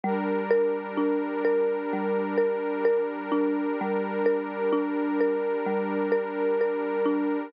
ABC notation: X:1
M:4/4
L:1/8
Q:1/4=64
K:Dm
V:1 name="Marimba"
G, B D B G, B B D | G, B D B G, B B D |]
V:2 name="Pad 2 (warm)"
[G,DB]8- | [G,DB]8 |]